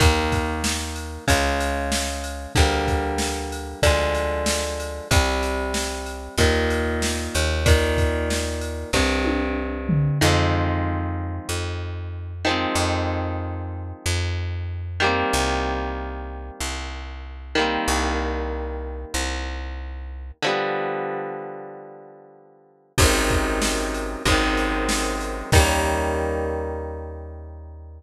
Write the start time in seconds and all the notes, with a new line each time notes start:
0.00 D#2 D#3 A#3, kick, ride
0.32 kick, ride
0.64 snare
0.96 ride
1.28 C#2 C#3 G#3, kick, ride
1.61 ride
1.92 snare
2.24 ride
2.55 D2 D3 G3, kick, ride
2.59 A#3
2.88 kick, ride
3.18 snare
3.52 ride
3.82 D2 D3 F3, kick, ride
3.87 G#3
4.14 ride
4.46 snare
4.80 ride
5.11 C2 C3 G3, kick, ride
5.43 ride
5.74 snare
6.06 ride
6.38 D#2 A#2 D#3, kick, ride
6.70 ride
7.02 snare
7.35 D#2, ride
7.66 A#2 D#3, kick, ride
7.98 kick, ride
8.30 snare
8.61 ride
8.93 C2 G2 C3, kick, snare
9.25 high tom
9.89 floor tom
10.21 F2 D#3 F3 G#3
10.27 C4
11.49 F2
12.45 D#3 F3 G#3
12.51 C4
12.75 F2
14.06 F2
15.00 D#3 G3 A#3
15.06 C4
15.33 C2
16.61 C2
17.55 D#3 G3 A#3
17.61 C4
17.88 C2
19.14 C2
20.42 D3 F3 G3
20.48 B3
22.98 G#1 F#2 G#2, kick, crash
23.02 C3 D#3
23.30 kick, ride
23.62 snare
23.94 ride
24.25 G#1 F#2 G#2, kick, ride
24.30 C3 D#3
24.57 ride
24.89 snare
25.21 ride
25.52 D#2 D#3 G3, kick, crash
25.57 A#3 C#4